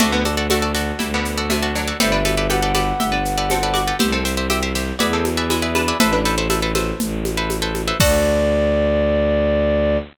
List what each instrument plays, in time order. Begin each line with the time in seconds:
0.00 violin D2, pizzicato strings C3 A3 F#4 A4 D5, low conga, shaker
0.12 pizzicato strings D3 B3
0.25 pizzicato strings F#4 A4 D5, high conga, shaker
0.37 pizzicato strings F#4 A4 D5
0.50 pizzicato strings A3 F#4 A4 D5, high conga, shaker
0.62 pizzicato strings F#4 A4 D5
0.75 pizzicato strings F#4 A4 D5, snare, shaker
0.99 violin D2, pizzicato strings G3 E4, low conga, shaker
1.14 pizzicato strings D3 B3
1.25 shaker
1.38 pizzicato strings F#4 A4 D5
1.50 pizzicato strings C3 A3, high conga, shaker
1.62 pizzicato strings F#4 A4 D5
1.75 pizzicato strings F#3 D4, shaker
1.88 pizzicato strings F#4 A4 D5
2.00 violin G1, pizzicato strings C4 G4 A4 B4 D5, flute E5, low conga, shaker
2.12 pizzicato strings D4 B4
2.25 pizzicato strings G4 A4 B4 D5, high conga, shaker
2.37 pizzicato strings G4 A4 B4 D5
2.50 pizzicato strings G4 A4 B4 D5 G5, flute F#5, high conga, shaker
2.62 pizzicato strings G4 A4 B4 D5
2.75 pizzicato strings G4 A4 B4 D5, snare, high conga, shaker
3.00 violin G1, pizzicato strings G4 E5, low conga, shaker
3.12 pizzicato strings D4 B4
3.25 shaker
3.38 pizzicato strings G4 A4 B4 D5
3.50 pizzicato strings C4 A4, high conga, shaker
3.63 pizzicato strings G4 A4 B4 D5
3.74 pizzicato strings F#4 D5, high conga, shaker
3.88 pizzicato strings G4 A4 B4 D5
3.99 violin C2, pizzicato strings B3 G4 C5 E5, low conga, shaker
4.12 pizzicato strings C4 A4
4.25 pizzicato strings G4 C5 E5, shaker
4.37 pizzicato strings G4 C5 E5
4.50 pizzicato strings G4 C5 E5, high conga, shaker
4.62 pizzicato strings G4 C5 E5
4.75 pizzicato strings G4 C5 E5, snare, shaker
4.99 violin E2, pizzicato strings F#4 G#4 B4 D5 E5, low conga, shaker
5.13 pizzicato strings C4 A4
5.25 high conga, shaker
5.37 pizzicato strings G#4 B4 D5 E5
5.50 pizzicato strings G#3 E4, high conga, shaker
5.62 pizzicato strings G#4 B4 D5 E5
5.75 pizzicato strings D4 B4, high conga, shaker
5.88 pizzicato strings G#4 B4 D5 E5
6.00 violin A1, pizzicato strings E4 A4 B4 C5 E5, low conga, shaker
6.13 pizzicato strings D4 B4
6.25 pizzicato strings A4 B4 C5 E5, shaker
6.38 pizzicato strings A4 B4 C5 E5
6.50 pizzicato strings A4 B4 C5 E5, high conga, shaker
6.62 pizzicato strings A4 B4 C5 E5
6.75 pizzicato strings A4 B4 C5 E5, snare, high conga, shaker
7.00 violin A1, low conga, shaker
7.25 high conga, shaker
7.37 pizzicato strings A4 B4 C5 E5
7.50 high conga, shaker
7.62 pizzicato strings A4 B4 C5 E5
7.75 high conga, shaker
7.88 pizzicato strings A4 B4 C5 E5
8.00 violin D2, pizzicato strings F#4 A4 D5, flute D5, kick, crash